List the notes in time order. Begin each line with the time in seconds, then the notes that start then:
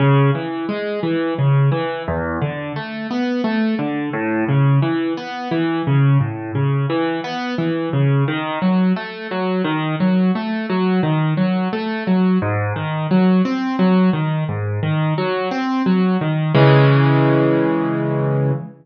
0.00 C#3
0.35 E3
0.69 G#3
1.03 E3
1.39 C#3
1.72 E3
2.08 E2
2.42 D3
2.76 A3
3.10 B3
3.44 A3
3.79 D3
4.13 A2
4.48 C#3
4.82 E3
5.17 B3
5.51 E3
5.87 C#3
6.21 A2
6.55 C#3
6.90 E3
7.24 B3
7.58 E3
7.93 C#3
8.28 D#3
8.62 F#3
8.96 A3
9.31 F#3
9.65 D#3
10.00 F#3
10.35 A3
10.70 F#3
11.03 D#3
11.37 F#3
11.73 A3
12.07 F#3
12.42 G#2
12.76 D#3
13.11 F#3
13.45 C4
13.79 F#3
14.13 D#3
14.49 G#2
14.83 D#3
15.18 F#3
15.51 C4
15.86 F#3
16.21 D#3
16.55 C#3 E3 G#3